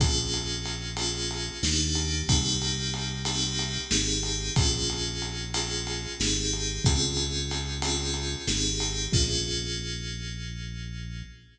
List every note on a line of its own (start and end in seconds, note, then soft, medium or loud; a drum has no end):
0.00 1.50 A#1 medium
0.00 0.88 A#3 loud
0.00 0.88 C#4 loud
0.00 0.88 F4 loud
0.00 0.88 G#4 loud
0.00 kick loud
0.00 ride loud
0.34 ride medium
0.65 ride medium
0.97 1.56 A#3 medium
0.97 1.56 C#4 medium
0.97 1.56 F4 medium
0.97 1.56 G#4 medium
0.97 ride loud
1.31 ride medium
1.63 2.23 D#2 medium
1.63 2.21 A#3 loud
1.63 2.21 D4 loud
1.63 2.21 D#4 loud
1.63 2.21 G4 loud
1.63 snare loud
1.95 ride medium
2.28 3.78 C2 medium
2.28 3.17 A#3 loud
2.28 3.17 C4 loud
2.28 3.17 D#4 loud
2.28 3.17 G4 loud
2.28 kick loud
2.28 ride loud
2.62 ride medium
2.94 ride medium
3.25 3.84 A#3 medium
3.25 3.84 C4 loud
3.25 3.84 D#4 medium
3.25 3.84 G4 medium
3.25 ride loud
3.59 ride medium
3.90 4.51 G#1 medium
3.90 4.50 C4 loud
3.90 4.50 D#4 loud
3.90 4.50 G4 loud
3.90 4.50 G#4 loud
3.90 snare loud
4.23 ride medium
4.56 6.07 A#1 medium
4.56 5.45 A#3 loud
4.56 5.45 C#4 loud
4.56 5.45 F4 loud
4.56 5.45 G#4 loud
4.56 kick loud
4.56 ride loud
4.90 ride medium
5.22 ride medium
5.54 6.12 A#3 medium
5.54 6.12 C#4 medium
5.54 6.12 F4 medium
5.54 6.12 G#4 loud
5.54 ride loud
5.87 ride medium
6.19 6.80 G#1 medium
6.19 6.78 C4 loud
6.19 6.78 D#4 loud
6.19 6.78 G4 loud
6.19 6.78 G#4 loud
6.19 snare loud
6.53 ride medium
6.85 8.35 C#2 medium
6.85 7.73 C4 loud
6.85 7.73 C#4 loud
6.85 7.73 F4 loud
6.85 7.73 G#4 loud
6.85 kick loud
6.85 ride loud
7.17 ride medium
7.51 ride medium
7.82 8.42 C4 medium
7.82 8.42 C#4 medium
7.82 8.42 F4 loud
7.82 8.42 G#4 medium
7.82 ride loud
8.14 ride medium
8.47 9.08 G#1 medium
8.47 9.06 C4 loud
8.47 9.06 D#4 loud
8.47 9.06 G4 loud
8.47 9.06 G#4 loud
8.47 snare loud
8.80 ride medium
9.12 11.23 A#1 loud
9.12 11.24 A#3 loud
9.12 11.24 C#4 loud
9.12 11.24 F4 loud
9.12 11.24 G#4 loud
9.12 kick loud
9.12 crash loud